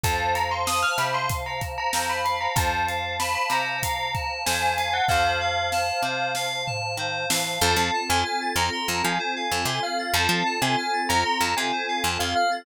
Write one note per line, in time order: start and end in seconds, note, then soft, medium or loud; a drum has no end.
0.04 0.84 F2 medium
0.04 0.32 C5 medium
0.04 2.54 C5 medium
0.04 2.54 F5 medium
0.04 0.34 A5 medium
0.04 2.54 A5 medium
0.04 kick medium
0.04 closed hi-hat medium
0.35 0.64 F5 medium
0.35 0.50 A#5 medium
0.35 closed hi-hat medium
0.51 0.66 C6 medium
0.67 0.96 A5 medium
0.67 0.82 D#6 medium
0.67 snare medium
0.83 0.98 F6 medium
0.98 1.78 C3 medium
0.98 1.27 C5 medium
0.98 1.14 B5 medium
0.98 snare soft
0.98 closed hi-hat medium
1.14 1.29 C6 medium
1.29 1.59 F5 medium
1.29 kick medium
1.29 closed hi-hat medium
1.46 1.61 A#5 medium
1.61 1.90 A5 medium
1.61 kick medium
1.61 closed hi-hat medium
1.78 2.07 A#5 medium
1.93 2.48 F2 medium
1.93 2.22 C5 medium
1.93 snare medium
2.10 2.25 B5 medium
2.25 2.53 F5 medium
2.25 2.40 B5 medium
2.25 closed hi-hat medium
2.41 2.56 A#5 medium
2.56 3.36 F2 medium
2.56 2.85 C5 medium
2.56 5.08 C5 medium
2.56 5.08 F5 medium
2.56 3.15 A5 medium
2.56 5.08 A5 medium
2.56 kick medium
2.56 closed hi-hat medium
2.88 3.16 F5 medium
2.88 closed hi-hat medium
3.20 3.48 A5 medium
3.20 3.35 B5 medium
3.20 snare medium
3.35 3.50 B5 medium
3.50 4.30 C3 medium
3.50 3.80 C5 medium
3.50 4.32 A#5 medium
3.50 snare soft
3.50 closed hi-hat medium
3.83 4.11 F5 medium
3.83 kick medium
3.83 closed hi-hat medium
4.14 4.43 A5 medium
4.14 kick medium
4.14 closed hi-hat soft
4.46 5.01 F2 medium
4.46 4.74 C5 medium
4.46 4.61 G#5 medium
4.46 snare loud
4.62 4.77 G#5 medium
4.78 5.06 F5 medium
4.78 4.93 G#5 medium
4.78 snare soft
4.78 closed hi-hat medium
4.93 5.08 F#5 medium
5.08 5.92 F2 medium
5.08 5.37 C5 loud
5.08 7.61 C5 medium
5.08 6.47 F5 medium
5.08 7.61 F5 medium
5.08 7.61 A5 medium
5.08 kick medium
5.08 snare medium
5.41 5.69 F5 medium
5.72 6.01 A5 medium
5.72 snare medium
6.03 6.83 C3 medium
6.03 6.33 C5 medium
6.35 6.64 F5 medium
6.35 snare medium
6.67 6.95 A5 medium
6.67 floor tom medium
6.97 7.26 D#3 medium
6.97 7.27 C5 medium
7.30 7.59 E3 medium
7.30 7.59 F5 medium
7.30 snare loud
7.61 7.76 F2 loud
7.61 10.12 C4 medium
7.61 10.12 F4 medium
7.61 10.12 A4 medium
7.61 7.76 C5 medium
7.61 8.01 A5 medium
7.76 7.91 F2 medium
7.76 7.92 F5 medium
7.94 8.08 A5 medium
8.09 8.24 F2 loud
8.09 8.50 G#5 medium
8.09 8.23 C6 medium
8.25 8.39 F6 medium
8.41 8.55 A6 medium
8.56 8.70 F2 loud
8.56 9.02 A#5 medium
8.56 8.71 F6 medium
8.72 8.86 C6 medium
8.88 9.03 F2 medium
8.88 9.02 A5 medium
9.04 9.19 F3 loud
9.04 9.18 F5 soft
9.04 9.62 G#5 medium
9.19 9.34 C5 medium
9.36 9.50 F5 medium
9.51 9.66 F2 medium
9.51 9.65 A5 medium
9.65 9.80 C3 medium
9.65 9.82 G#5 medium
9.65 9.81 C6 medium
9.83 10.12 F5 medium
9.83 9.97 F6 medium
9.99 10.13 A6 medium
10.13 10.28 F2 loud
10.13 12.63 C4 medium
10.13 12.63 F4 medium
10.13 12.63 A4 medium
10.13 10.29 C5 medium
10.13 10.54 A5 medium
10.29 10.43 F3 loud
10.29 10.44 F5 medium
10.46 10.60 A5 medium
10.62 10.76 C3 medium
10.62 11.00 G#5 medium
10.62 10.76 C6 medium
10.78 10.92 F6 medium
10.93 11.08 A6 medium
11.09 11.24 F2 medium
11.09 11.51 A#5 medium
11.09 11.23 F6 medium
11.25 11.39 C6 medium
11.41 11.55 F2 medium
11.41 11.55 A5 medium
11.57 11.72 C3 medium
11.57 11.71 F5 medium
11.57 12.08 G#5 medium
11.72 11.86 C5 medium
11.88 12.03 F5 medium
12.04 12.18 F2 medium
12.04 12.18 A5 medium
12.19 12.34 F2 medium
12.19 12.34 F5 medium
12.19 12.34 C6 medium
12.36 12.63 F5 medium
12.36 12.50 F6 medium
12.51 12.65 A6 medium